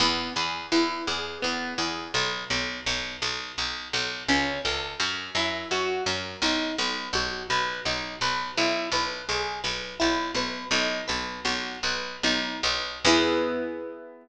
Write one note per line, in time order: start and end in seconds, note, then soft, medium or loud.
0.00 0.30 E2 medium
0.00 0.33 B3 medium
0.36 0.67 E2 medium
0.36 0.68 G#4 medium
0.71 1.02 E2 medium
0.71 1.04 E4 medium
1.07 1.38 E2 medium
1.07 1.40 G#4 medium
1.42 1.74 E2 medium
1.42 1.74 B3 medium
1.78 2.08 E2 medium
1.78 2.11 G#4 medium
2.14 2.44 B1 medium
2.50 2.81 B1 medium
2.86 3.17 B1 medium
3.22 3.52 B1 medium
3.58 3.88 B1 medium
3.93 4.24 B1 medium
4.28 4.59 C#2 medium
4.28 4.61 C#4 medium
4.64 4.95 C#2 medium
4.64 4.97 A4 medium
5.00 5.30 F#2 medium
5.00 5.32 C#4 medium
5.35 5.65 F#2 medium
5.35 5.69 E4 medium
5.71 6.01 F#2 medium
5.71 6.04 F#4 medium
6.06 6.37 F#2 medium
6.06 6.39 A#4 medium
6.42 6.72 B1 medium
6.42 6.75 D#4 medium
6.78 7.09 B1 medium
6.78 7.11 B4 medium
7.13 7.43 B1 medium
7.13 7.47 F#4 medium
7.50 7.80 B1 medium
7.50 7.82 B4 medium
7.85 8.16 B1 medium
7.85 8.18 D#4 medium
8.21 8.51 B1 medium
8.21 8.54 B4 medium
8.57 8.88 B1 medium
8.57 8.89 E4 medium
8.92 9.22 B1 medium
8.92 9.25 B4 medium
9.29 9.59 B1 medium
9.29 9.61 G#4 medium
9.64 9.94 B1 medium
9.64 9.96 B4 medium
9.99 10.31 B1 medium
9.99 10.31 E4 medium
10.35 10.65 B1 medium
10.35 10.68 B4 medium
10.71 11.02 B1 medium
10.71 11.04 D#4 medium
11.08 11.40 B1 medium
11.08 11.41 B4 medium
11.45 11.77 B1 medium
11.45 11.79 F#4 medium
11.83 12.17 B1 medium
11.83 12.19 B4 medium
12.23 12.58 B1 medium
12.23 12.60 D#4 medium
12.63 12.99 B1 medium
12.63 13.02 B4 medium
13.05 14.28 E2 loud
13.05 14.28 B3 loud
13.05 14.28 E4 medium
13.05 14.28 G#4 loud